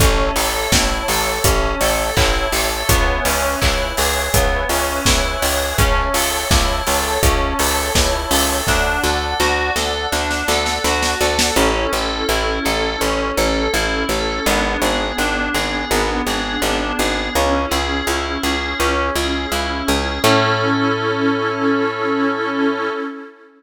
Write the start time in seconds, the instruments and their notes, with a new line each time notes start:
0.00 electric bass (finger) A1, electric piano 2 C#4, pad 5 (bowed) C#5 E5 A5, kick, closed hi-hat
0.36 electric bass (finger) A1, electric piano 2 A4, open hi-hat
0.72 electric bass (finger) A1, electric piano 2 E4, kick, snare
1.08 electric bass (finger) A1, electric piano 2 A4, open hi-hat
1.44 electric bass (finger) A1, electric piano 2 C#4, kick, closed hi-hat
1.81 electric bass (finger) A1, electric piano 2 A4, open hi-hat
2.17 electric bass (finger) A1, electric piano 2 E4, kick, clap
2.52 electric bass (finger) A1, electric piano 2 A4, open hi-hat
2.89 electric bass (finger) C#2, electric piano 2 B3, pad 5 (bowed) B4 C#5 E5 G#5, kick, closed hi-hat
3.25 electric bass (finger) C#2, electric piano 2 C#4, open hi-hat
3.61 electric bass (finger) C#2, electric piano 2 E4, kick, clap
3.97 electric bass (finger) C#2, electric piano 2 G#4, open hi-hat
4.34 electric bass (finger) C#2, electric piano 2 B3, kick, closed hi-hat
4.69 electric bass (finger) C#2, electric piano 2 C#4, open hi-hat
5.05 electric bass (finger) C#2, electric piano 2 E4, kick, snare
5.42 electric bass (finger) C#2, electric piano 2 G#4, open hi-hat
5.78 electric bass (finger) C#2, electric piano 2 C#4, pad 5 (bowed) C#5 E5 A5, kick, closed hi-hat
6.14 electric bass (finger) C#2, electric piano 2 A4, open hi-hat
6.51 electric bass (finger) C#2, electric piano 2 E4, kick, snare
6.87 electric bass (finger) C#2, electric piano 2 A4, open hi-hat
7.23 electric bass (finger) C#2, electric piano 2 C#4, kick, closed hi-hat
7.59 electric bass (finger) C#2, electric piano 2 A4, open hi-hat
7.95 electric bass (finger) C#2, electric piano 2 E4, kick, snare
8.31 electric bass (finger) C#2, electric piano 2 A4, open hi-hat
8.66 electric bass (finger) D2, electric piano 2 D4, pad 5 (bowed) D5 F#5 A5, kick, snare
9.03 electric bass (finger) D2, electric piano 2 A4, snare
9.40 electric bass (finger) D2, electric piano 2 F#4, snare
9.76 electric bass (finger) D2, electric piano 2 A4, snare
10.12 electric bass (finger) D2, electric piano 2 D4, snare
10.31 snare
10.48 electric bass (finger) D2, electric piano 2 A4, snare
10.66 snare
10.84 electric bass (finger) D2, electric piano 2 F#4, snare
11.03 snare
11.21 electric bass (finger) D2, electric piano 2 A4, snare
11.39 snare
11.56 electric bass (finger) A1, electric piano 2 C#4, pad 5 (bowed) C#4 E4 A4
11.93 electric bass (finger) A1, electric piano 2 A4
12.29 electric bass (finger) A1, electric piano 2 E4
12.65 electric bass (finger) A1, electric piano 2 A4
13.01 electric bass (finger) A1, electric piano 2 C#4
13.37 electric bass (finger) A1, electric piano 2 A4
13.73 electric bass (finger) A1, electric piano 2 E4
14.09 electric bass (finger) A1, electric piano 2 A4
14.46 electric bass (finger) G#1, electric piano 2 B3, pad 5 (bowed) B3 D4 G#4
14.82 electric bass (finger) G#1, electric piano 2 G#4
15.18 electric bass (finger) G#1, electric piano 2 D4
15.54 electric bass (finger) G#1, electric piano 2 G#4
15.90 electric bass (finger) G#1, electric piano 2 B3
16.27 electric bass (finger) G#1, electric piano 2 G#4
16.62 electric bass (finger) G#1, electric piano 2 D4
16.99 electric bass (finger) G#1, electric piano 2 G#4
17.35 electric bass (finger) C#2, pad 5 (bowed) C#4 E4 G#4, electric piano 2 C#4
17.71 electric bass (finger) C#2, electric piano 2 G#4
18.07 electric bass (finger) C#2, electric piano 2 E4
18.43 electric bass (finger) C#2, electric piano 2 G#4
18.79 electric bass (finger) C#2, electric piano 2 C#4
19.16 electric bass (finger) C#2, electric piano 2 G#4
19.52 electric bass (finger) C#2, electric piano 2 E4
19.88 electric bass (finger) C#2, electric piano 2 G#4
20.24 electric bass (finger) A2, pad 5 (bowed) C#4 E4 A4, electric piano 2 C#4 E4 A4